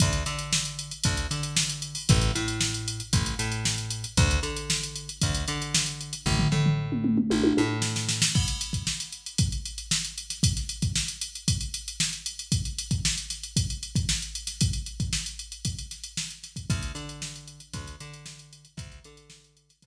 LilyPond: <<
  \new Staff \with { instrumentName = "Electric Bass (finger)" } { \clef bass \time 4/4 \key d \dorian \tempo 4 = 115 d,8 d4. d,8 d4. | a,,8 a,4. a,,8 a,4. | d,8 d4. d,8 d4. | a,,8 a,4. a,,8 a,4. |
r1 | r1 | r1 | r1 |
d,8 d4. d,8 d4. | d,8 d4. d,8 r4. | }
  \new DrumStaff \with { instrumentName = "Drums" } \drummode { \time 4/4 <hh bd>16 hh16 hh16 hh16 sn16 hh16 hh16 hh16 <hh bd>16 hh16 hh16 hh16 sn16 hh16 hh16 hho16 | <hh bd>16 hh16 hh16 hh16 sn16 hh16 hh16 hh16 <hh bd>16 hh16 hh16 hh16 sn16 hh16 hh16 hh16 | <hh bd>16 hh16 hh16 hh16 sn16 hh16 hh16 hh16 <hh bd>16 hh16 hh16 hh16 sn16 hh16 hh16 hh16 | <bd tomfh>16 tomfh16 tomfh16 tomfh16 r16 toml16 toml16 toml16 tommh16 tommh16 tommh8 sn16 sn16 sn16 sn16 |
<cymc bd>16 hh16 hh16 <hh bd>16 sn16 <hh sn>16 hh16 hh16 <hh bd>16 hh16 hh16 hh16 sn16 hh16 hh16 <hh sn>16 | <hh bd>16 <hh sn>16 hh16 <hh bd>16 sn16 hh16 hh16 hh16 <hh bd>16 hh16 hh16 hh16 sn16 hh16 hh16 hh16 | <hh bd>16 hh16 hh16 <hh bd>16 sn16 <hh sn>16 <hh sn>16 hh16 <hh bd>16 hh16 hh16 <hh bd>16 sn16 hh16 hh16 <hh sn>16 | <hh bd>16 hh16 hh16 <hh bd>16 sn16 hh16 hh16 hh16 <hh bd>16 hh16 <hh sn>16 hh16 sn16 hh16 <hh sn>16 <hh bd>16 |
<hh bd>16 hh16 hh16 hh16 sn16 hh16 hh16 hh16 <hh bd>16 hh16 hh16 hh16 sn16 hh16 hh16 hh16 | <hh bd>16 hh16 hh16 hh16 sn16 hh16 hh16 <hh sn>16 <hh bd>4 r4 | }
>>